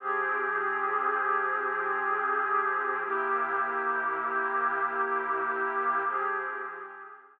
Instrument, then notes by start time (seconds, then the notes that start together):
pad 5 (bowed)
0.00 F3 C4 G4 G#4
3.04 C3 A#3 E4 G4
6.07 F3 C4 G4 G#4